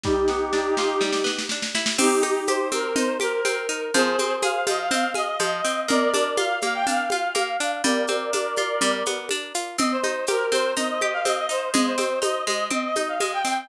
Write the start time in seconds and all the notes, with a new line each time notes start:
0.04 G3 D#4 G4, kick, snare
0.28 B3, snare
0.53 D4, snare
0.77 F4, snare
1.01 G3, snare
1.13 snare
1.24 B3, snare
1.39 snare
1.49 D4, snare
1.62 snare
1.75 E4, snare
1.86 snare
1.98 C4 D#4 G4, crash, low conga, shaker
2.23 D#4, high conga, shaker
2.47 G4 C5, high conga, shaker
2.72 C4 A#4, high conga, shaker
2.84 A#4
2.96 D#4 C5, low conga, shaker
3.20 G4 A#4, high conga, shaker
3.45 C4, high conga, shaker
3.69 D#4, shaker
3.94 F3 G#4 C5, low conga, shaker
4.19 C4, high conga, shaker
4.42 G#4 F5, high conga, shaker
4.67 F3 D#5, high conga, shaker
4.79 F5
4.91 C4 F5, low conga, shaker
5.14 G#4 D#5, high conga, shaker
5.39 F3, high conga, shaker
5.64 C4, shaker
5.88 A#3 A#4 D5, low conga, shaker
6.14 D4, high conga, shaker
6.37 F4 F5, high conga, shaker
6.61 A#3 F5, high conga, shaker
6.74 G5
6.87 D4 F5, low conga, shaker
7.10 F4 F5, high conga, shaker
7.35 A#3, high conga, shaker
7.60 D4, shaker
7.84 G3 A#4 D5, low conga, shaker
8.07 C4, high conga, shaker
8.33 D4, high conga, shaker
8.56 F4, high conga, shaker
8.81 G3, low conga, shaker
9.06 B3, high conga, shaker
9.29 D4, high conga, shaker
9.54 F4, shaker
9.78 C4 D#5, low conga, shaker
9.92 C5
10.04 D#4, high conga, shaker
10.27 G4 A#4, high conga, shaker
10.52 C4 C5, high conga, shaker
10.76 D#4 D#5, low conga, shaker
10.89 D#5
11.01 G4 D#5, high conga
11.13 F5
11.25 C4 D#5, high conga, shaker
11.38 D#5
11.49 D#4 C5, shaker
11.74 G#3 D#5, low conga, shaker
11.86 C5
11.98 C4, high conga, shaker
12.22 D#4 D#5, high conga, shaker
12.47 G#3 D#5, high conga, shaker
12.71 C4 D#5, low conga
12.84 D#5
12.96 D#4 D#5, high conga, shaker
13.09 F5
13.20 G#3 D#5, high conga, shaker
13.33 G5
13.45 C4 G5, shaker